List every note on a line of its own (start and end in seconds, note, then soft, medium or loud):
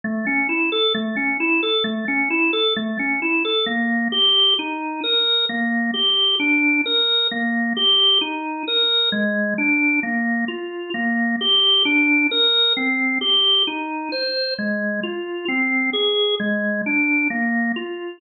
0.04 0.25 A3 loud
0.27 0.47 C#4 medium
0.49 0.70 E4 medium
0.72 0.93 A4 medium
0.95 1.15 A3 loud
1.16 1.37 C#4 medium
1.40 1.61 E4 medium
1.63 1.84 A4 medium
1.84 2.05 A3 medium
2.08 2.29 C#4 medium
2.30 2.51 E4 medium
2.53 2.74 A4 medium
2.76 2.97 A3 medium
2.99 3.20 C#4 medium
3.22 3.43 E4 medium
3.45 3.66 A4 medium
3.66 4.08 A#3 medium
4.12 4.54 G4 medium
4.59 5.01 D#4 medium
5.04 5.45 A#4 medium
5.49 5.91 A#3 medium
5.94 6.35 G4 medium
6.39 6.81 D4 medium
6.86 7.27 A#4 medium
7.31 7.73 A#3 medium
7.77 8.18 G4 medium
8.21 8.63 D#4 medium
8.68 9.09 A#4 medium
9.12 9.54 G#3 medium
9.58 10.00 D4 medium
10.03 10.45 A#3 medium
10.48 10.90 F4 medium
10.94 11.36 A#3 medium
11.41 11.83 G4 medium
11.85 12.27 D4 medium
12.31 12.73 A#4 medium
12.77 13.18 C4 medium
13.21 13.63 G4 medium
13.67 14.09 D#4 medium
14.12 14.54 C5 medium
14.59 15.00 G#3 medium
15.03 15.45 F4 medium
15.48 15.90 C4 medium
15.93 16.35 G#4 medium
16.40 16.81 G#3 medium
16.86 17.28 D4 medium
17.30 17.72 A#3 medium
17.76 18.18 F4 medium